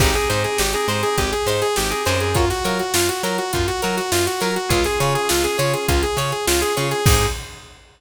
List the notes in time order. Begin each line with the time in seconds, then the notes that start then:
0.00 G#1 C4 D#4 G4 G#4 C5, kick, crash
0.14 C4 D#4 G4 G#4, snare, closed hi-hat
0.29 G#2 D#4 G4 G#4 C5, closed hi-hat
0.44 G#4, closed hi-hat
0.58 G#1 G4, snare
0.73 C4 D#4 G4 G#4, closed hi-hat
0.88 G#2 D#4 G4 G#4 C5, closed hi-hat
1.03 G#4, closed hi-hat
1.18 G#1 G4, kick, closed hi-hat
1.32 G#4, closed hi-hat
1.46 G#2 D#4 G4 G#4 C5, closed hi-hat
1.62 G#4, closed hi-hat
1.76 G#1 G4, snare
1.90 C4 D#4 G4 G#4, closed hi-hat
2.05 F#2 C4 D#4 G4 G#4 C5, closed hi-hat
2.20 G#4, closed hi-hat
2.35 F4 F#4 A#4 C#5, kick, closed hi-hat
2.50 F#4, snare, closed hi-hat
2.64 F#3 F4 F#4 A#4 C#5, closed hi-hat
2.79 F#4, closed hi-hat
2.94 F#2 F4, snare
3.09 F#4, closed hi-hat
3.23 F#3 F4 F#4 A#4 C#5, closed hi-hat
3.38 F#4, closed hi-hat
3.53 F#2 F4, kick, closed hi-hat
3.67 F#4, snare, closed hi-hat
3.82 F#3 F4 F#4 A#4 C#5, closed hi-hat
3.97 F#4, snare, closed hi-hat
4.12 F#2 F4, snare
4.26 F#4, closed hi-hat
4.40 F#3 F4 F#4 A#4 C#5, closed hi-hat
4.56 F#4, closed hi-hat
4.69 C#2 C#4 F4 G#4 C#5, kick, closed hi-hat
4.84 C#4 F4 G#4, snare, closed hi-hat
5.00 C#3 F4 G#4 C#5, closed hi-hat
5.15 G#4, closed hi-hat
5.29 C#2 F4, snare
5.44 C#4 F4 G#4, closed hi-hat
5.58 C#3 F4 G#4 C#5, closed hi-hat
5.73 G#4, closed hi-hat
5.88 C#2 F4, kick, closed hi-hat
6.03 G#4, closed hi-hat
6.17 C#3 F4 G#4 C#5, closed hi-hat
6.32 G#4, closed hi-hat
6.47 C#2 F4, snare
6.61 C#4 F4 G#4, closed hi-hat
6.76 C#3 C#4 F4 G#4 C#5, closed hi-hat
6.91 G#4, snare, closed hi-hat
7.05 G#2 C4 D#4 G4 G#4 C5, kick, crash